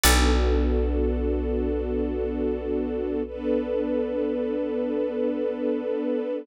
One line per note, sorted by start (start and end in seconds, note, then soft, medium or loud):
0.04 5.96 B1 loud
0.04 3.22 B3 medium
0.04 3.22 D4 medium
0.04 3.22 F#4 medium
0.04 6.33 A4 medium
0.04 3.22 A4 medium
0.04 6.33 B4 loud
0.04 6.33 D5 medium
0.04 6.33 F#5 medium
3.26 6.45 B3 medium
3.26 6.45 D4 medium
3.26 6.45 A4 medium
3.26 6.45 B4 medium